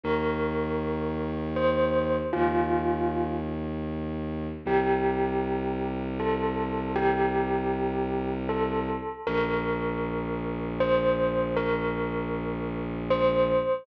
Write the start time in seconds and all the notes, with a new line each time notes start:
0.03 D#2 A#4
1.56 C5
2.33 D#2 F4
4.65 C2 G4
6.19 A4
6.96 G4
8.49 A4
9.27 A#1 A#4
10.80 C5
11.56 A#4
13.10 C5